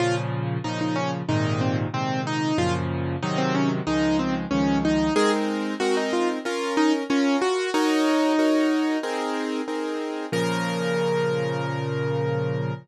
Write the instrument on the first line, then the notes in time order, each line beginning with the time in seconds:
acoustic grand piano
0.00 A#2 C#3 F3 F4
0.64 A#2 C#3 F3 D#4
0.81 D#4
0.96 C#4
1.28 G#2 A#2 C3 D#3 D#4
1.61 C4
1.94 G#2 A#2 C3 D#3 C4
2.27 D#4
2.58 F#2 A#2 C#3 F3 F4
3.23 G#2 C3 D#3 F#3 D#4
3.38 C4
3.55 C#4
3.87 C#2 D#3 F3 G#3 D#4
4.19 C4
4.51 C#2 D#3 F3 G#3 C#4
4.85 D#4
5.16 G#3 C4 D#4 G#4 A#4
5.80 G#3 C4 D#4 F#4 A#4
5.97 D#4
6.13 F4
6.45 C#4 F4 A#4
6.77 D#4
7.10 C#4 F4 A#4
7.42 F#4
7.74 D#4 F#4 A#4 C#5
8.39 D#4 F#4 A#4 C#5
9.03 C4 D#4 G#4 A#4
9.68 C4 D#4 G#4 A#4
10.32 A#2 C#3 F3 A#4